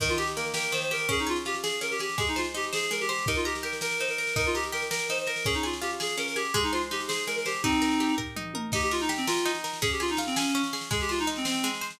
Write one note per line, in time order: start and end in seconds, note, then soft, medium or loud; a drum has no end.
0.00 0.72 D#3 medium
0.00 0.08 A#4 loud
0.00 kick loud
0.00 snare medium
0.09 0.18 F4 medium
0.09 snare medium
0.18 0.54 G4 medium
0.18 0.27 G4 medium
0.18 snare medium
0.27 snare medium
0.36 1.06 A#3 medium
0.36 0.45 A#4 medium
0.36 snare medium
0.46 snare medium
0.54 0.91 G4 medium
0.54 0.71 A#4 medium
0.54 snare loud
0.62 snare medium
0.72 1.07 D#3 medium
0.72 0.81 C5 medium
0.72 snare medium
0.82 0.90 C5 medium
0.82 snare medium
0.91 1.08 G4 medium
0.91 1.09 A#4 medium
0.91 snare medium
0.99 snare medium
1.09 1.81 C#4 medium
1.09 1.19 G#4 loud
1.09 kick medium
1.09 snare medium
1.19 1.28 D#4 medium
1.19 snare medium
1.27 1.37 F4 medium
1.27 1.63 G#4 medium
1.27 snare medium
1.36 snare medium
1.45 2.15 F4 medium
1.45 1.55 G4 medium
1.45 snare medium
1.54 snare medium
1.63 1.79 G#4 medium
1.63 2.00 G#4 medium
1.63 snare loud
1.72 snare medium
1.81 2.16 C#4 medium
1.81 1.91 A#4 medium
1.81 snare medium
1.91 2.00 G4 medium
1.91 snare medium
1.99 2.19 G4 medium
1.99 2.18 G#4 medium
1.99 snare medium
2.09 snare medium
2.18 2.90 G#3 medium
2.18 2.28 G#4 medium
2.18 kick loud
2.18 snare medium
2.27 2.37 D#4 medium
2.27 snare medium
2.36 2.46 F4 medium
2.36 2.72 C5 medium
2.36 snare medium
2.44 snare medium
2.54 3.24 D#4 medium
2.54 2.65 G4 medium
2.54 snare medium
2.63 snare medium
2.73 2.90 G#4 medium
2.73 3.08 C5 medium
2.73 snare loud
2.83 snare medium
2.91 3.25 G#3 medium
2.91 3.00 A#4 medium
2.91 snare medium
3.01 3.09 G4 medium
3.01 snare medium
3.09 3.26 G4 medium
3.09 3.26 C5 medium
3.09 snare medium
3.18 snare medium
3.26 4.00 D#4 medium
3.26 3.36 A#4 medium
3.26 kick loud
3.26 snare medium
3.35 3.45 F4 medium
3.35 snare medium
3.45 3.54 G4 medium
3.45 3.81 A#4 medium
3.45 snare medium
3.55 snare medium
3.63 4.32 G4 medium
3.63 3.72 A#4 medium
3.63 snare medium
3.73 snare medium
3.81 4.18 A#4 medium
3.81 3.98 A#4 medium
3.81 snare loud
3.91 snare medium
3.99 4.35 D#4 medium
3.99 4.08 C5 medium
3.99 snare medium
4.08 4.17 A#4 medium
4.08 snare medium
4.18 4.34 A#4 medium
4.18 4.36 A#4 medium
4.18 snare medium
4.27 snare medium
4.36 5.09 D#4 medium
4.36 4.46 A#4 loud
4.36 kick loud
4.36 snare medium
4.45 4.55 F4 medium
4.45 snare medium
4.55 4.64 G4 medium
4.55 4.90 A#4 medium
4.55 snare medium
4.63 snare medium
4.72 5.42 G4 medium
4.72 4.82 A#4 medium
4.72 snare medium
4.82 snare medium
4.91 5.06 A#4 medium
4.91 5.27 A#4 medium
4.91 snare loud
4.99 snare medium
5.09 5.44 D#4 medium
5.09 5.18 C5 medium
5.09 snare medium
5.18 5.27 C5 medium
5.18 snare medium
5.27 5.45 A#4 soft
5.27 5.45 A#4 medium
5.27 snare medium
5.36 snare medium
5.44 6.17 C#4 medium
5.44 5.54 G#4 loud
5.44 kick loud
5.44 snare medium
5.54 5.63 D#4 medium
5.54 snare medium
5.63 5.74 F4 medium
5.63 5.99 G#4 medium
5.63 snare medium
5.73 snare medium
5.81 6.51 F4 medium
5.81 5.90 G4 medium
5.81 snare medium
5.91 snare medium
6.00 6.36 G#4 medium
6.00 6.16 G#4 medium
6.00 snare loud
6.09 snare medium
6.17 6.52 C#4 medium
6.17 6.27 A#4 medium
6.17 snare medium
6.27 6.36 A#4 medium
6.27 snare medium
6.36 6.54 G4 medium
6.36 6.53 G#4 medium
6.36 snare medium
6.45 snare medium
6.54 7.27 G#3 medium
6.54 6.63 G#4 loud
6.54 kick medium
6.54 snare medium
6.63 6.72 D#4 medium
6.63 snare medium
6.73 6.81 F4 medium
6.73 7.08 C5 medium
6.73 snare medium
6.82 snare medium
6.91 7.60 D#4 medium
6.91 7.00 G4 medium
6.91 snare medium
7.00 snare medium
7.08 7.25 G#4 medium
7.08 7.45 C5 medium
7.08 snare loud
7.18 snare medium
7.27 7.62 G#3 medium
7.27 7.36 A#4 medium
7.27 snare medium
7.36 7.45 A#4 medium
7.36 snare medium
7.46 7.62 G4 medium
7.46 7.63 C5 medium
7.46 snare medium
7.55 snare medium
7.63 8.15 C4 medium
7.63 8.15 D#4 medium
7.63 8.36 D#4 medium
7.63 kick loud
7.63 snare medium
7.73 snare medium
7.82 8.17 A#4 medium
7.82 snare medium
7.91 snare medium
8.00 8.69 G4 medium
8.00 snare medium
8.09 snare medium
8.18 8.54 A#4 medium
8.18 kick medium
8.18 floor tom medium
8.36 8.71 D#4 medium
8.36 mid tom medium
8.54 8.72 A#4 medium
8.54 high tom medium
8.72 9.45 D#4 medium
8.72 8.82 G4 medium
8.72 kick loud
8.72 snare medium
8.72 crash loud
8.81 8.91 G4 medium
8.81 snare medium
8.91 9.00 F4 medium
8.91 9.27 A#4 medium
8.91 snare medium
9.00 9.09 D#4 loud
9.00 snare medium
9.09 9.78 G4 medium
9.09 snare medium
9.17 9.26 C4 medium
9.17 snare medium
9.27 9.51 F4 medium
9.27 9.64 A#4 medium
9.27 snare loud
9.37 snare medium
9.45 9.80 D#4 medium
9.45 snare medium
9.54 snare medium
9.64 9.81 A#4 medium
9.64 snare medium
9.73 snare medium
9.82 10.54 C#4 medium
9.82 9.90 G#4 loud
9.82 kick loud
9.82 snare medium
9.91 10.01 G4 medium
9.91 snare medium
10.00 10.10 F4 medium
10.00 10.36 G#4 medium
10.00 snare medium
10.08 10.19 D#4 medium
10.08 snare medium
10.17 10.87 F4 medium
10.17 snare medium
10.27 10.35 C4 medium
10.27 snare medium
10.36 10.62 C#4 medium
10.36 10.73 G#4 medium
10.36 snare loud
10.46 snare medium
10.54 10.89 C#4 medium
10.54 snare medium
10.63 snare medium
10.73 10.90 G#4 medium
10.73 snare medium
10.81 snare medium
10.91 11.63 G#3 medium
10.91 11.00 G#4 medium
10.91 kick loud
10.91 snare medium
11.00 11.10 G4 medium
11.00 snare medium
11.09 11.19 F4 medium
11.09 11.45 C5 medium
11.09 snare medium
11.19 11.28 D#4 loud
11.19 snare medium
11.27 11.96 D#4 medium
11.27 snare medium
11.36 11.45 C4 medium
11.36 snare medium
11.45 11.69 C4 medium
11.45 11.81 C5 medium
11.45 snare loud
11.54 snare medium
11.63 11.98 G#3 medium
11.63 snare medium
11.74 snare medium
11.81 11.99 C5 medium
11.81 snare medium
11.90 snare medium